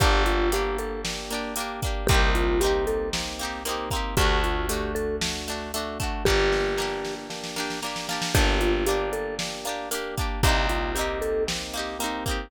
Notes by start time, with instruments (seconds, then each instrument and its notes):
0.00 electric bass (finger) G1, electric piano 1 A#3 D4 G4, acoustic guitar (steel) A#3 D4 G4, vibraphone G4, kick, closed hi-hat
0.26 vibraphone F4, closed hi-hat
0.52 electric piano 1 A#3 D4 G4, acoustic guitar (steel) A#3 D4 G4, vibraphone G4, closed hi-hat
0.78 vibraphone A4, closed hi-hat
1.05 electric piano 1 A#3 D4 G4, snare
1.31 acoustic guitar (steel) A#3 D4 G4, closed hi-hat
1.56 electric piano 1 A#3 D4 G4, acoustic guitar (steel) A#3 D4, closed hi-hat
1.60 acoustic guitar (steel) G4
1.82 acoustic guitar (steel) A#3 D4 G4, kick, closed hi-hat
2.07 electric bass (finger) C2, acoustic guitar (steel) A#3 C4, electric piano 1 A#3 C4 D#4 G4, vibraphone G4, kick, closed hi-hat
2.12 acoustic guitar (steel) D#4 G4
2.35 vibraphone F4, closed hi-hat
2.60 acoustic guitar (steel) A#3 C4, electric piano 1 A#3 C4 D#4 G4, vibraphone G4, closed hi-hat
2.64 acoustic guitar (steel) D#4 G4
2.87 vibraphone A4, closed hi-hat
3.13 electric piano 1 A#3 C4 D#4 G4, snare
3.39 acoustic guitar (steel) A#3 C4 D#4, closed hi-hat
3.45 acoustic guitar (steel) G4
3.65 acoustic guitar (steel) A#3 C4 D#4, electric piano 1 A#3 C4 D#4 G4, closed hi-hat
3.71 acoustic guitar (steel) G4
3.91 acoustic guitar (steel) A#3 C4, kick, closed hi-hat
3.95 acoustic guitar (steel) D#4 G4
4.17 electric bass (finger) D2, acoustic guitar (steel) A3 D4, electric piano 1 A3 D4 F#4, vibraphone G4, kick, closed hi-hat
4.21 acoustic guitar (steel) F#4
4.44 vibraphone F4, closed hi-hat
4.69 electric piano 1 A3 D4 F#4, acoustic guitar (steel) A3 D4, vibraphone G4, closed hi-hat
4.73 acoustic guitar (steel) F#4
4.95 vibraphone A4, closed hi-hat
5.21 electric piano 1 A3 D4 F#4, snare
5.48 acoustic guitar (steel) A3 D4 F#4, closed hi-hat
5.74 acoustic guitar (steel) A3 D4 F#4, electric piano 1 A3 D4 F#4, closed hi-hat
6.00 acoustic guitar (steel) A3 D4 F#4, kick, closed hi-hat
6.25 electric bass (finger) G1, acoustic guitar (steel) A#3 D4, electric piano 1 A#3 D4 G4, vibraphone G4, kick, snare
6.30 acoustic guitar (steel) G4
6.52 snare
6.77 acoustic guitar (steel) A#3 D4, electric piano 1 A#3 D4 G4, snare
6.82 acoustic guitar (steel) G4
7.05 snare
7.30 electric piano 1 A#3 D4 G4, snare
7.44 snare
7.56 acoustic guitar (steel) A#3 D4 G4, snare
7.70 snare
7.82 acoustic guitar (steel) A#3 D4, electric piano 1 A#3 D4 G4, snare
7.86 acoustic guitar (steel) G4
7.96 snare
8.09 acoustic guitar (steel) A#3 D4 G4, snare
8.22 snare
8.35 electric bass (finger) G1, acoustic guitar (steel) A#3 D4 G4, electric piano 1 A#3 D4 G4, vibraphone G4, kick, closed hi-hat
8.61 vibraphone F4, closed hi-hat
8.86 acoustic guitar (steel) A#3 D4, electric piano 1 A#3 D4 G4, vibraphone G4, closed hi-hat
8.90 acoustic guitar (steel) G4
9.13 vibraphone A4, closed hi-hat
9.39 electric piano 1 A#3 D4 G4, snare
9.65 acoustic guitar (steel) A#3 D4, closed hi-hat
9.69 acoustic guitar (steel) G4
9.91 acoustic guitar (steel) A#3 D4 G4, electric piano 1 A#3 D4 G4, closed hi-hat
10.17 acoustic guitar (steel) A#3 D4 G4, kick, closed hi-hat
10.43 electric bass (finger) C2, acoustic guitar (steel) A#3 C4 D#4, electric piano 1 A#3 C4 D#4 G4, vibraphone G4, kick, closed hi-hat
10.49 acoustic guitar (steel) G4
10.69 vibraphone F4, closed hi-hat
10.95 acoustic guitar (steel) A#3 C4, electric piano 1 A#3 C4 D#4 G4, vibraphone G4, closed hi-hat
10.99 acoustic guitar (steel) D#4 G4
11.22 vibraphone A4, closed hi-hat
11.47 electric piano 1 A#3 C4 D#4 G4, snare
11.73 acoustic guitar (steel) A#3 C4 D#4, closed hi-hat
11.79 acoustic guitar (steel) G4
11.99 electric piano 1 A#3 C4 D#4 G4, acoustic guitar (steel) A#3 C4, closed hi-hat
12.04 acoustic guitar (steel) D#4 G4
12.26 acoustic guitar (steel) A#3 C4 D#4, kick, closed hi-hat
12.31 acoustic guitar (steel) G4